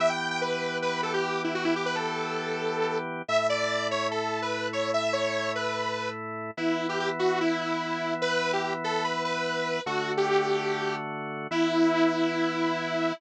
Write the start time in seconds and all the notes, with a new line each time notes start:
0.00 E3 B3 G4 E5
0.09 G5
0.30 G5
0.41 B4
0.82 B4
1.03 A4
1.13 G4
1.44 E4
1.54 F#4
1.64 E4
1.76 G4
1.86 B4
1.95 A4
3.28 A2 A3 E4 E5
3.49 D5
3.91 C#5
4.11 A4
4.42 B4
4.73 C#5
4.93 E5
5.13 C#5
5.55 B4
6.57 E3 B3 E4
6.89 G4
6.99 G4
7.19 F#4
7.40 E4
7.61 E4
8.21 B4
8.53 G4
8.63 G4
8.84 A4
9.04 B4
9.24 B4
9.86 D3 A3 F#4
10.17 G4
11.51 E3 B3 E4